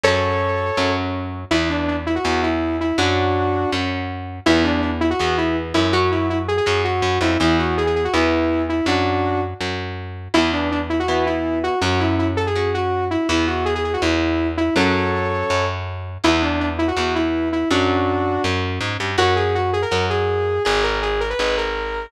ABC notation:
X:1
M:4/4
L:1/16
Q:1/4=163
K:Emix
V:1 name="Lead 2 (sawtooth)"
[Ac]10 z6 | E2 D2 D z E F3 E4 E2 | [DF]8 z8 | E2 D2 D z E F3 E2 z2 E2 |
F2 E2 E z G G3 F4 E2 | E2 F2 G G G F E6 E2 | [DF]6 z10 | E2 D2 D z E F3 E4 F2 |
F2 E2 E z A G3 F4 E2 | E2 F2 G G G F E6 E2 | [Ac]10 z6 | E2 D2 D z E F3 E4 E2 |
[DF]8 z8 | [K:F#mix] F2 G2 F2 G A3 G6 | G2 A2 G2 A B3 A6 |]
V:2 name="Overdriven Guitar"
[F,C]8 [F,C]8 | [E,B,]8 [E,B,]8 | [F,C]8 [F,C]8 | [E,B,]8 [E,B,]8 |
[F,C]8 [F,C]8 | [E,B,]8 [E,B,]8 | z16 | [E,B,]8 [E,B,]8 |
[F,C]8 [F,C]8 | [E,B,]16 | [F,C]16 | [E,B,]8 [E,B,]8 |
[F,C]8 [F,C]8 | [K:F#mix] [FAc]8 [FAc]8 | [Gd]8 [Gd]8 |]
V:3 name="Electric Bass (finger)" clef=bass
F,,8 F,,8 | E,,8 E,,8 | F,,8 F,,8 | E,,8 E,,6 F,,2- |
F,,8 F,,4 F,,2 =F,,2 | E,,8 E,,8 | F,,8 F,,8 | E,,16 |
F,,16 | E,,8 E,,8 | F,,8 F,,8 | E,,8 E,,8 |
F,,8 F,,4 G,,2 =G,,2 | [K:F#mix] F,,8 F,,8 | G,,,8 G,,,8 |]